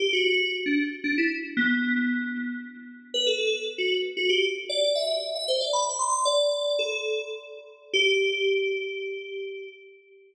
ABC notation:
X:1
M:3/4
L:1/16
Q:1/4=115
K:G
V:1 name="Electric Piano 2"
G F F2 z D z2 D E z2 | B,8 z4 | B A A2 z F z2 F G z2 | d2 e3 e c d b2 c'2 |
"^rit." d4 A4 z4 | G12 |]